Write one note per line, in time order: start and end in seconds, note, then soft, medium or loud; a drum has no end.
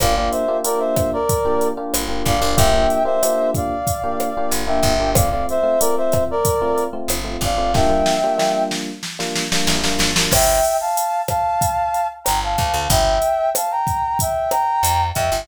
0.00 0.29 G1 loud
0.00 0.13 A#3 medium
0.00 0.13 D4 medium
0.00 0.13 F4 loud
0.00 0.13 G4 medium
0.00 0.15 D5 medium
0.00 0.15 F5 loud
0.00 kick medium
0.00 cross-stick loud
0.00 closed hi-hat medium
0.16 0.43 A#3 medium
0.16 0.43 D4 medium
0.16 0.43 F4 medium
0.16 0.43 G4 medium
0.16 0.31 D5 medium
0.16 0.31 F5 medium
0.31 0.58 C5 medium
0.31 0.58 E5 medium
0.31 closed hi-hat medium
0.48 0.61 A#3 medium
0.48 0.61 D4 medium
0.48 0.61 F4 medium
0.48 0.61 G4 medium
0.64 1.16 A#3 medium
0.64 1.16 D4 medium
0.64 1.16 F4 medium
0.64 1.16 G4 medium
0.64 0.80 A#4 medium
0.64 0.80 D5 medium
0.64 closed hi-hat medium
0.79 1.10 C5 medium
0.79 1.10 E5 medium
0.96 kick medium
0.96 cross-stick medium
0.96 closed hi-hat medium
1.13 1.68 A#4 medium
1.13 1.68 D5 medium
1.29 kick medium
1.29 closed hi-hat medium
1.45 1.71 A#3 medium
1.45 1.71 D4 medium
1.45 1.71 F4 medium
1.45 1.71 G4 medium
1.61 closed hi-hat medium
1.77 2.03 A#3 medium
1.77 2.03 D4 medium
1.77 2.03 F4 medium
1.77 2.03 G4 medium
1.94 2.23 G1 medium
1.94 cross-stick medium
1.94 closed hi-hat loud
2.08 2.34 A#3 medium
2.08 2.34 D4 medium
2.08 2.34 F4 medium
2.08 2.34 G4 medium
2.26 2.40 G1 medium
2.26 2.58 D5 medium
2.26 2.58 F5 medium
2.26 kick medium
2.26 closed hi-hat medium
2.41 2.56 G1 medium
2.41 2.54 A#3 medium
2.41 2.54 D4 medium
2.41 2.54 F4 medium
2.41 2.54 G4 medium
2.57 2.87 G1 loud
2.57 2.70 A#3 medium
2.57 2.70 D4 medium
2.57 2.70 F4 medium
2.57 2.70 G4 medium
2.57 3.03 E5 medium
2.57 3.03 G5 loud
2.57 kick medium
2.57 closed hi-hat medium
2.73 2.99 A#3 medium
2.73 2.99 D4 medium
2.73 2.99 F4 medium
2.73 2.99 G4 medium
2.90 closed hi-hat medium
3.05 3.18 A#3 medium
3.05 3.18 D4 medium
3.05 3.18 F4 medium
3.05 3.18 G4 medium
3.05 3.50 C5 medium
3.05 3.50 E5 medium
3.23 3.74 A#3 medium
3.23 3.74 D4 medium
3.23 3.74 F4 medium
3.23 3.74 G4 medium
3.23 cross-stick medium
3.23 closed hi-hat medium
3.54 4.50 D5 medium
3.54 4.50 F5 medium
3.54 kick medium
3.54 closed hi-hat medium
3.87 kick medium
3.87 closed hi-hat medium
4.04 4.29 A#3 medium
4.04 4.29 D4 medium
4.04 4.29 F4 medium
4.04 4.29 G4 medium
4.20 cross-stick medium
4.20 closed hi-hat medium
4.37 4.63 A#3 medium
4.37 4.63 D4 medium
4.37 4.63 F4 medium
4.37 4.63 G4 medium
4.51 4.80 G1 medium
4.51 closed hi-hat medium
4.67 4.93 A#3 medium
4.67 4.93 D4 medium
4.67 4.93 F4 medium
4.67 4.93 G4 medium
4.67 5.10 E5 medium
4.67 5.10 G5 medium
4.83 5.44 G1 loud
4.83 kick medium
4.83 closed hi-hat medium
5.00 5.13 A#3 medium
5.00 5.13 D4 medium
5.00 5.13 F4 medium
5.00 5.13 G4 medium
5.15 5.28 A3 medium
5.15 5.28 C4 medium
5.15 5.28 F4 medium
5.15 5.30 D5 medium
5.15 5.30 F5 medium
5.15 kick medium
5.15 cross-stick medium
5.15 closed hi-hat loud
5.31 5.58 A3 medium
5.31 5.58 C4 medium
5.31 5.58 F4 medium
5.31 5.46 D5 medium
5.31 5.46 F5 medium
5.49 5.80 C5 medium
5.49 5.80 E5 medium
5.49 closed hi-hat soft
5.63 5.76 A3 medium
5.63 5.76 C4 medium
5.63 5.76 F4 medium
5.80 6.33 A3 medium
5.80 6.33 C4 medium
5.80 6.33 F4 medium
5.80 5.95 A#4 medium
5.80 5.95 D5 medium
5.80 closed hi-hat loud
5.97 6.24 C5 medium
5.97 6.24 E5 medium
6.12 kick medium
6.12 cross-stick medium
6.12 closed hi-hat medium
6.31 6.84 A#4 medium
6.31 6.84 D5 loud
6.45 kick medium
6.45 closed hi-hat medium
6.61 6.87 A3 medium
6.61 6.87 C4 medium
6.61 6.87 F4 medium
6.78 closed hi-hat medium
6.93 7.19 A3 medium
6.93 7.19 C4 medium
6.93 7.19 F4 medium
7.08 7.37 G1 medium
7.08 cross-stick medium
7.08 closed hi-hat medium
7.24 7.50 A3 medium
7.24 7.50 C4 medium
7.24 7.50 F4 medium
7.41 8.02 G1 medium
7.41 7.73 D5 medium
7.41 7.73 F5 medium
7.41 kick medium
7.41 closed hi-hat medium
7.58 7.71 A3 medium
7.58 7.71 C4 medium
7.58 7.71 F4 medium
7.74 7.87 G3 loud
7.74 7.87 A#3 medium
7.74 7.87 D4 loud
7.74 7.87 F4 loud
7.74 8.64 E5 medium
7.74 8.64 G5 loud
7.74 kick medium
7.74 snare medium
7.89 8.15 G3 medium
7.89 8.15 A#3 medium
7.89 8.15 D4 medium
7.89 8.15 F4 medium
8.06 snare medium
8.24 8.37 G3 medium
8.24 8.37 A#3 medium
8.24 8.37 D4 medium
8.24 8.37 F4 medium
8.38 8.90 G3 medium
8.38 8.90 A#3 medium
8.38 8.90 D4 medium
8.38 8.90 F4 medium
8.38 snare medium
8.71 snare medium
9.03 snare medium
9.19 9.45 G3 medium
9.19 9.45 A#3 medium
9.19 9.45 D4 medium
9.19 9.45 F4 medium
9.19 snare medium
9.35 snare medium
9.52 9.78 G3 medium
9.52 9.78 A#3 medium
9.52 9.78 D4 medium
9.52 9.78 F4 medium
9.52 snare medium
9.67 9.96 A1 medium
9.67 snare medium
9.84 10.10 G3 medium
9.84 10.10 A#3 medium
9.84 10.10 D4 medium
9.84 10.10 F4 medium
9.84 snare medium
9.99 10.28 G#1 medium
9.99 snare medium
10.16 10.29 G3 medium
10.16 10.29 A#3 medium
10.16 10.29 D4 medium
10.16 10.29 F4 medium
10.16 snare medium
10.31 10.60 G1 loud
10.31 10.77 E5 loud
10.31 10.77 G5 loud
10.31 kick medium
10.31 cross-stick medium
10.31 crash medium
10.65 closed hi-hat medium
10.81 11.22 F5 medium
10.81 11.22 A5 medium
10.97 closed hi-hat medium
11.28 12.08 F5 medium
11.28 12.08 A5 loud
11.28 kick medium
11.28 cross-stick medium
11.28 closed hi-hat medium
11.61 kick medium
11.61 closed hi-hat medium
11.94 closed hi-hat medium
12.24 12.56 G1 medium
12.24 12.40 G5 medium
12.24 12.40 A#5 medium
12.24 cross-stick medium
12.24 closed hi-hat medium
12.44 12.87 F5 medium
12.44 12.87 A5 medium
12.58 12.73 D2 medium
12.58 kick medium
12.58 closed hi-hat medium
12.74 12.88 D2 medium
12.90 13.19 G1 loud
12.90 13.50 E5 medium
12.90 13.50 G5 loud
12.90 kick medium
12.90 closed hi-hat medium
13.22 closed hi-hat medium
13.55 13.71 F5 medium
13.55 13.71 A5 medium
13.55 cross-stick medium
13.55 closed hi-hat medium
13.71 14.18 G5 medium
13.71 14.18 A#5 medium
13.87 kick medium
13.87 closed hi-hat medium
14.19 14.51 E5 medium
14.19 14.50 G5 medium
14.19 kick medium
14.19 closed hi-hat medium
14.51 15.06 G5 medium
14.51 15.06 A#5 loud
14.51 cross-stick medium
14.51 closed hi-hat medium
14.83 15.12 F2 medium
14.83 closed hi-hat loud
15.15 15.31 F2 medium
15.15 15.41 E5 medium
15.15 15.41 G5 medium
15.15 kick medium
15.15 closed hi-hat medium
15.32 15.46 G1 medium